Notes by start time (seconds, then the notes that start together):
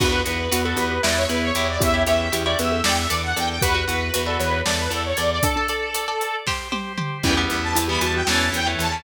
0.00 E2 B3 D4 F#4 B4, kick, crash
0.12 F#4 B4
0.25 E2 F#4 B4, closed hi-hat
0.51 E2 F#4 B4, closed hi-hat
0.65 F#4 A4 B4
0.77 E2 G4 B4, closed hi-hat
0.91 G4
1.03 E2 B3 E4 B4 D5, snare
1.17 C#5
1.29 E2 E4 B4, closed hi-hat
1.42 C#5
1.55 E2 E4 G4 C#5, closed hi-hat
1.69 D5
1.80 E2 C#4 E4 G4 E5, kick, closed hi-hat
1.94 E4 G4 C#5
2.06 E2 E4 G4 C#5 E5, closed hi-hat
2.32 E2 E4 G4 C#5, closed hi-hat
2.46 E4 G4 C#5 D5
2.59 E2 B4 E5, closed hi-hat
2.72 A4
2.84 E2 D4 A4 D5 G5, snare
2.98 E5
3.09 E2 A4 D5, closed hi-hat
3.23 F#5
3.36 E2 A4 D5 G5, closed hi-hat
3.49 G5
3.62 E2 F#4 G4 B4, kick, closed hi-hat
3.74 F#4 B4
3.87 E2 F#4 B4, closed hi-hat
4.14 E2 F#4 B4, closed hi-hat
4.26 F#4 A4 B4 D5
4.40 E2 B4 C#5, closed hi-hat
4.51 C#5
4.64 E2 A4 D5, snare
4.78 B4
4.90 E2 A4 D5, closed hi-hat
5.05 C#5
5.17 E2 A4 D5, closed hi-hat
5.31 D5
5.42 D4 A4 D5, kick, closed hi-hat
5.56 D4 A4 D5
5.68 A4 D5, closed hi-hat
5.95 A4 D5, closed hi-hat
6.08 A4 D5
6.21 closed hi-hat
6.46 G4 C5, kick, snare
6.72 G4 C5, high tom
6.98 G4 C5, mid tom
7.23 E2 E3 G3 B3 C#4 E4 G4 B4 G5, kick, crash
7.37 E3 G3 B3
7.50 E2, closed hi-hat
7.62 A5
7.75 E2 E4, closed hi-hat
7.88 E3 G3 B3 G4 B5
8.01 E2 E3 G3 B3 F#4 A5, closed hi-hat
8.14 F#4 G5
8.27 E2 E3 A3 C#4 E4 A4 C#5 A5, snare
8.52 E2 G5, closed hi-hat
8.67 E3 A3 C#4
8.79 E2 A5, closed hi-hat
8.92 E3 A3 C#4